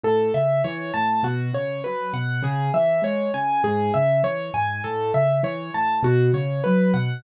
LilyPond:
<<
  \new Staff \with { instrumentName = "Acoustic Grand Piano" } { \time 4/4 \key cis \minor \tempo 4 = 100 a'8 e''8 cis''8 a''8 fis'8 cis''8 b'8 fis''8 | gis'8 e''8 cis''8 gis''8 gis'8 e''8 cis''8 gis''8 | a'8 e''8 cis''8 a''8 fis'8 cis''8 b'8 fis''8 | }
  \new Staff \with { instrumentName = "Acoustic Grand Piano" } { \clef bass \time 4/4 \key cis \minor a,8 cis8 e8 a,8 b,8 cis8 fis8 b,8 | cis8 e8 gis8 cis8 gis,8 cis8 e8 gis,8 | a,8 cis8 e8 a,8 b,8 cis8 fis8 b,8 | }
>>